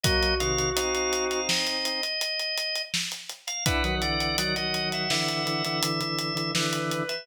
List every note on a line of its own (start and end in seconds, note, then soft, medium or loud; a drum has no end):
0.03 0.34 F#3 medium
0.03 0.34 A#3 medium
0.03 1.40 F#4 medium
0.03 0.35 D#5 loud
0.03 kick loud
0.03 closed hi-hat loud
0.23 closed hi-hat medium
0.40 0.71 C3 medium
0.40 0.71 D#3 medium
0.40 0.70 F5 medium
0.40 closed hi-hat medium
0.58 closed hi-hat medium
0.76 2.01 C4 medium
0.76 2.01 D#4 medium
0.76 0.94 F5 medium
0.76 closed hi-hat loud
0.94 1.25 F5 medium
0.94 closed hi-hat medium
1.13 closed hi-hat medium
1.30 1.48 F5 medium
1.30 closed hi-hat medium
1.49 2.82 D#5 medium
1.49 snare loud
1.67 closed hi-hat medium
1.85 closed hi-hat medium
2.03 closed hi-hat medium
2.21 closed hi-hat medium
2.39 closed hi-hat medium
2.58 closed hi-hat medium
2.75 closed hi-hat medium
2.94 snare loud
3.12 closed hi-hat medium
3.30 closed hi-hat medium
3.47 3.64 F5 medium
3.47 closed hi-hat medium
3.66 3.83 D4 medium
3.66 3.83 E4 medium
3.66 3.95 B4 loud
3.66 4.35 F#5 medium
3.66 kick loud
3.66 closed hi-hat loud
3.84 4.01 D#3 medium
3.84 4.01 F#3 medium
3.84 closed hi-hat medium
4.02 4.36 D3 medium
4.02 4.36 E3 medium
4.02 4.37 D5 medium
4.02 closed hi-hat medium
4.20 closed hi-hat medium
4.38 4.55 D#3 medium
4.38 4.55 F#3 medium
4.38 4.55 D5 medium
4.38 5.79 F#5 medium
4.38 closed hi-hat loud
4.56 5.08 D#3 medium
4.56 5.08 F#3 medium
4.56 4.89 D#5 medium
4.56 closed hi-hat medium
4.74 closed hi-hat medium
4.92 5.10 E5 medium
4.92 closed hi-hat medium
5.10 5.44 D3 medium
5.10 5.44 E3 medium
5.10 6.51 E5 medium
5.10 snare loud
5.28 closed hi-hat medium
5.45 5.63 D3 medium
5.45 5.63 E3 medium
5.45 closed hi-hat medium
5.65 5.82 D3 medium
5.65 5.82 E3 medium
5.65 closed hi-hat medium
5.83 6.00 D3 medium
5.83 6.00 E3 medium
5.83 closed hi-hat loud
6.01 6.34 D3 medium
6.01 6.34 E3 medium
6.01 closed hi-hat medium
6.19 closed hi-hat medium
6.35 6.52 D3 medium
6.35 6.52 E3 medium
6.35 closed hi-hat medium
6.55 7.03 D3 medium
6.55 7.03 E3 medium
6.55 7.26 B4 medium
6.55 snare loud
6.73 closed hi-hat medium
6.91 closed hi-hat medium
7.09 7.26 E5 medium
7.09 closed hi-hat medium